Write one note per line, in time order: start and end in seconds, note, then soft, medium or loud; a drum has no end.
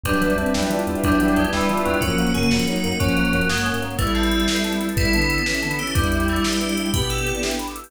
0.03 0.13 E2 medium
0.03 0.32 F#3 medium
0.03 1.03 G3 medium
0.03 0.33 G3 medium
0.03 0.32 D4 medium
0.03 1.99 G4 medium
0.03 1.99 B4 loud
0.03 0.70 B4 loud
0.03 1.99 D5 loud
0.03 1.99 E5 medium
0.03 kick medium
0.03 closed hi-hat loud
0.13 closed hi-hat medium
0.21 0.30 E3 medium
0.21 0.87 B3 medium
0.21 0.87 D5 medium
0.21 closed hi-hat medium
0.30 closed hi-hat medium
0.36 0.45 E2 medium
0.36 0.54 C4 medium
0.36 0.70 D4 medium
0.36 1.03 E5 medium
0.36 closed hi-hat medium
0.46 closed hi-hat medium
0.54 0.63 E2 medium
0.54 0.69 F#3 medium
0.54 0.69 D4 medium
0.54 1.52 E4 medium
0.54 1.19 G5 medium
0.54 snare loud
0.63 closed hi-hat medium
0.70 0.79 E3 medium
0.70 1.36 D4 medium
0.70 1.03 F4 medium
0.70 1.37 B4 medium
0.70 closed hi-hat medium
0.79 closed hi-hat medium
0.87 0.96 E2 medium
0.87 1.19 B3 medium
0.87 1.52 D5 medium
0.87 closed hi-hat medium
0.95 closed hi-hat medium
1.03 1.14 E2 medium
1.03 1.44 F#3 medium
1.03 1.97 G3 medium
1.03 1.35 G3 medium
1.03 1.44 D4 medium
1.03 1.69 E5 medium
1.03 kick loud
1.03 closed hi-hat loud
1.12 closed hi-hat medium
1.20 1.30 E3 medium
1.20 1.85 B3 medium
1.20 1.84 G5 medium
1.20 closed hi-hat medium
1.28 closed hi-hat medium
1.36 1.46 E2 medium
1.36 1.51 G#3 medium
1.36 1.69 D4 medium
1.36 1.99 B4 medium
1.36 closed hi-hat medium
1.45 closed hi-hat medium
1.52 1.61 E2 medium
1.52 1.81 E3 medium
1.52 1.68 G3 medium
1.52 1.99 E4 medium
1.52 1.68 E4 medium
1.52 1.99 D5 medium
1.52 snare loud
1.61 closed hi-hat medium
1.69 1.78 E3 medium
1.69 2.00 D4 medium
1.69 2.00 F4 medium
1.69 2.00 E5 medium
1.69 closed hi-hat medium
1.77 closed hi-hat medium
1.85 1.95 E2 medium
1.85 1.99 F#3 medium
1.85 2.01 B3 medium
1.85 2.01 G5 medium
1.85 closed hi-hat medium
1.94 closed hi-hat medium
2.01 2.10 F#2 medium
2.01 2.32 F3 medium
2.01 3.95 F#3 medium
2.01 2.17 F#3 medium
2.01 3.95 A#3 loud
2.01 3.95 C#4 medium
2.01 2.32 C#4 medium
2.01 2.31 F#4 medium
2.01 2.34 A#4 loud
2.01 kick loud
2.01 closed hi-hat loud
2.10 closed hi-hat medium
2.18 2.29 F#3 medium
2.18 2.33 A#3 medium
2.18 2.83 F#5 medium
2.18 closed hi-hat medium
2.27 closed hi-hat medium
2.34 2.45 F#2 medium
2.34 2.50 C#3 medium
2.34 2.50 A#3 medium
2.34 2.49 C#4 medium
2.34 2.49 G#4 medium
2.34 2.67 A#4 medium
2.34 closed hi-hat medium
2.43 closed hi-hat medium
2.51 2.60 F#2 medium
2.51 2.65 F3 medium
2.51 2.66 A#3 medium
2.51 2.65 C#4 medium
2.51 2.82 F#4 medium
2.51 3.00 C#5 medium
2.51 snare loud
2.59 closed hi-hat medium
2.67 2.76 F#3 medium
2.67 2.82 F#3 medium
2.67 2.94 F#3 medium
2.67 2.94 D#4 medium
2.67 3.16 A#4 medium
2.67 closed hi-hat medium
2.76 closed hi-hat medium
2.84 2.94 F#2 medium
2.84 2.99 A#3 medium
2.84 2.99 F#4 medium
2.84 3.50 F#5 medium
2.84 closed hi-hat medium
2.92 closed hi-hat medium
3.00 3.10 F#2 medium
3.00 3.45 F3 medium
3.00 3.40 F#3 medium
3.00 3.45 C#4 medium
3.00 3.15 C#4 medium
3.00 3.81 C#5 medium
3.00 kick loud
3.00 closed hi-hat loud
3.08 closed hi-hat medium
3.16 3.27 F#3 medium
3.16 3.31 A#3 medium
3.16 3.33 A#4 medium
3.16 closed hi-hat medium
3.25 closed hi-hat medium
3.33 3.42 F#2 medium
3.33 3.48 F#3 medium
3.33 3.65 A#4 medium
3.33 closed hi-hat medium
3.41 closed hi-hat medium
3.49 3.72 G2 medium
3.49 3.63 G#3 medium
3.49 3.64 A#3 medium
3.49 3.97 F#5 medium
3.49 snare loud
3.58 closed hi-hat medium
3.65 3.81 C#4 medium
3.65 3.97 A#4 medium
3.65 closed hi-hat medium
3.74 3.96 G#2 medium
3.74 closed hi-hat medium
3.82 3.97 A#3 medium
3.82 3.98 C#5 medium
3.82 closed hi-hat medium
3.91 closed hi-hat medium
3.98 4.44 A1 loud
3.98 4.85 G3 medium
3.98 4.14 A3 medium
3.98 5.95 B3 medium
3.98 4.85 E4 medium
3.98 5.95 E4 medium
3.98 5.95 A4 loud
3.98 4.06 B4 loud
3.98 kick loud
3.98 closed hi-hat loud
4.07 4.14 E5 medium
4.07 closed hi-hat medium
4.15 4.62 C4 medium
4.15 4.23 A5 medium
4.15 closed hi-hat medium
4.23 4.31 B5 medium
4.23 closed hi-hat medium
4.31 4.39 E6 medium
4.31 closed hi-hat medium
4.40 4.47 A6 medium
4.40 closed hi-hat medium
4.48 4.55 B4 medium
4.48 snare loud
4.56 4.64 E5 medium
4.56 closed hi-hat medium
4.64 4.72 A5 medium
4.64 closed hi-hat medium
4.72 4.80 B5 medium
4.72 closed hi-hat medium
4.81 4.88 E6 medium
4.81 closed hi-hat medium
4.89 4.97 A6 medium
4.89 closed hi-hat medium
4.96 5.36 A1 medium
4.96 5.12 G3 medium
4.96 5.12 E4 medium
4.96 5.71 E4 medium
4.96 5.04 B4 medium
4.96 kick loud
4.96 closed hi-hat loud
5.05 5.13 E5 medium
5.05 closed hi-hat medium
5.13 5.40 D3 medium
5.13 5.40 B3 medium
5.13 5.21 A5 medium
5.13 closed hi-hat loud
5.21 5.29 B5 medium
5.21 closed hi-hat medium
5.30 5.38 E6 medium
5.30 closed hi-hat medium
5.37 5.45 A6 medium
5.37 closed hi-hat medium
5.46 5.61 E3 medium
5.46 5.61 C#4 medium
5.46 5.54 B4 medium
5.46 snare loud
5.54 5.62 E5 medium
5.54 closed hi-hat medium
5.62 5.78 D3 medium
5.62 5.78 B3 medium
5.62 5.70 A5 medium
5.62 closed hi-hat medium
5.71 5.78 B5 medium
5.71 closed hi-hat medium
5.79 5.95 E3 medium
5.79 5.95 C#4 medium
5.79 5.93 G4 medium
5.79 5.86 E6 medium
5.79 closed hi-hat medium
5.87 5.95 A6 medium
5.87 closed hi-hat medium
5.95 6.40 E2 loud
5.95 6.23 G3 medium
5.95 6.86 G3 medium
5.95 7.90 B3 medium
5.95 7.90 D4 medium
5.95 6.86 E4 medium
5.95 7.90 E4 medium
5.95 7.90 G4 medium
5.95 6.03 B4 medium
5.95 kick loud
5.95 closed hi-hat loud
6.04 6.11 D5 medium
6.04 closed hi-hat medium
6.12 6.19 E5 medium
6.12 closed hi-hat medium
6.20 6.27 G5 medium
6.20 closed hi-hat medium
6.28 6.44 A3 medium
6.28 6.36 B5 medium
6.28 closed hi-hat medium
6.36 6.43 D6 medium
6.36 closed hi-hat medium
6.44 6.88 G4 medium
6.44 6.51 E6 medium
6.44 snare loud
6.52 6.59 G6 medium
6.52 closed hi-hat medium
6.61 6.68 B4 medium
6.61 closed hi-hat medium
6.69 6.76 D5 medium
6.69 closed hi-hat medium
6.77 6.85 E5 medium
6.77 closed hi-hat medium
6.85 6.92 G5 medium
6.85 closed hi-hat medium
6.93 7.33 B2 medium
6.93 7.51 B3 medium
6.93 7.51 G4 medium
6.93 7.08 B4 medium
6.93 7.01 B5 medium
6.93 kick loud
6.93 closed hi-hat loud
7.02 7.09 D6 medium
7.02 closed hi-hat medium
7.10 7.39 A4 medium
7.10 7.17 E6 medium
7.10 closed hi-hat medium
7.18 7.26 G6 medium
7.18 closed hi-hat medium
7.26 7.33 B4 medium
7.26 closed hi-hat medium
7.34 7.42 D5 medium
7.34 closed hi-hat medium
7.43 7.50 E5 medium
7.43 snare loud
7.51 7.59 G5 medium
7.51 closed hi-hat medium
7.59 7.67 B5 medium
7.59 closed hi-hat medium
7.67 7.75 D6 medium
7.67 closed hi-hat medium
7.75 7.83 E6 medium
7.75 closed hi-hat medium
7.84 7.91 G6 medium
7.84 open hi-hat medium